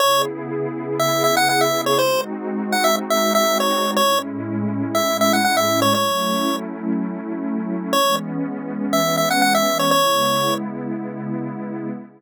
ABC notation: X:1
M:4/4
L:1/16
Q:1/4=121
K:C#m
V:1 name="Lead 1 (square)"
c2 z6 e2 e f f e2 c | ^B2 z4 f e z e2 e2 c3 | c2 z6 e2 e f f e2 c | c6 z10 |
c2 z6 e2 e f f e2 c | c6 z10 |]
V:2 name="Pad 2 (warm)"
[C,B,EG]16 | [G,^B,DF]16 | [A,,G,CE]16 | [F,A,CE]16 |
[E,G,B,C]16 | [C,G,B,E]16 |]